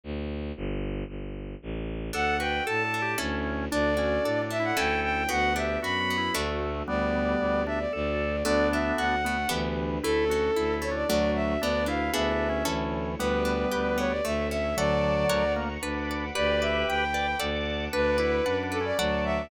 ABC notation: X:1
M:3/4
L:1/16
Q:1/4=114
K:D
V:1 name="Violin"
z4 | z12 | f2 g2 a4 z4 | d6 e f g2 g2 |
f2 e2 b4 z4 | d6 e d d4 | d2 e2 f4 z4 | A6 c d d2 e2 |
d2 =f2 e4 z4 | B6 c d e2 e2 | d6 z6 | d2 e2 g4 z4 |
B6 A d d2 e2 |]
V:2 name="Drawbar Organ"
z4 | z12 | A2 B2 (3A2 A2 G2 C4 | D2 C2 (3D2 D2 E2 A4 |
F2 G2 (3F2 F2 E2 A,4 | [G,B,]6 D z A4 | [B,D]6 B, z E,4 | E2 F2 (3E2 E2 D2 F,4 |
D2 E2 (3D2 D2 C2 E,4 | [G,B,]8 z4 | [D,F,]6 ^A, z D4 | [GB]6 d z d4 |
D2 E2 (3D2 D2 C2 F,4 |]
V:3 name="Orchestral Harp"
z4 | z12 | D2 F2 A2 D2 [CEA]4 | D2 F2 A2 D2 [CEA]4 |
B,2 D2 F2 B,2 [A,DF]4 | z12 | A,2 D2 F2 A,2 [B,DG]4 | A,2 C2 E2 A,2 [A,DF]4 |
B,2 D2 [B,E^G]4 [CEA]4 | B,2 D2 G2 B,2 A,2 C2 | [Adf]4 [^Acf]4 B2 d2 | B2 d2 g2 B2 [Adf]4 |
B2 d2 f2 B2 [Adf]4 |]
V:4 name="Violin" clef=bass
D,,4 | G,,,4 G,,,4 A,,,4 | D,,4 A,,4 D,,4 | D,,4 A,,4 D,,4 |
D,,4 F,,4 D,,4 | D,,4 D,,4 D,,4 | D,,4 D,,4 D,,4 | D,,4 D,,4 D,,4 |
D,,4 D,,4 D,,4 | D,,4 D,,4 D,,4 | D,,4 D,,4 D,,4 | D,,4 D,,4 D,,4 |
D,,4 F,,4 D,,4 |]
V:5 name="String Ensemble 1"
z4 | z12 | [DFA]4 [DAd]4 [CEA]4 | [DFA]4 [DAd]4 [CEA]4 |
[B,DF]4 [F,B,F]4 [A,DF]4 | [B,DG]4 [G,B,G]4 [A,DF]4 | [DFA]8 [DGB]4 | [CEA]8 [DFA]4 |
[DFB]4 [E^GB]4 [EAc]4 | [GBd]8 [Ace]4 | [fad']4 [f^ac']4 [fbd']4 | [gbd']8 [fad']4 |
[fbd']8 [fad']4 |]